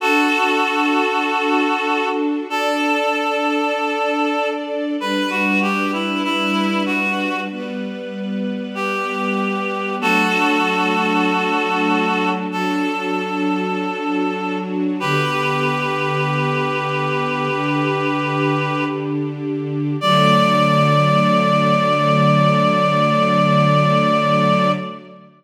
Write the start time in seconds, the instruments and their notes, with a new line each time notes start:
0.00 string ensemble 1 D4 F#4 A4, clarinet F#4 A4
2.49 string ensemble 1 D4 A4 D5, clarinet A4
5.00 string ensemble 1 G3 D4 B4, clarinet B4
5.30 clarinet F#4
5.62 clarinet G4
5.93 clarinet E4
6.24 clarinet E4
6.86 clarinet F#4
7.51 string ensemble 1 G3 B3 B4
8.75 clarinet G4
9.99 string ensemble 1 F#3 A3 D4, clarinet F#4 A4
12.51 string ensemble 1 F#3 D4 F#4, clarinet A4
15.00 string ensemble 1 D3 B3 G4, clarinet G4 B4
17.49 string ensemble 1 D3 D4 G4
20.01 string ensemble 1 D3 F#3 A3, clarinet D5